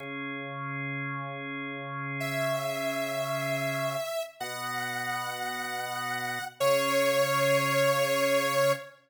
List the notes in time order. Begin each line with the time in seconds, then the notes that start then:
0.00 C#3 C#4 G#4
2.20 E5
4.40 B2 B3 F#4 F#5
6.60 C#3 C#4 G#4 C#5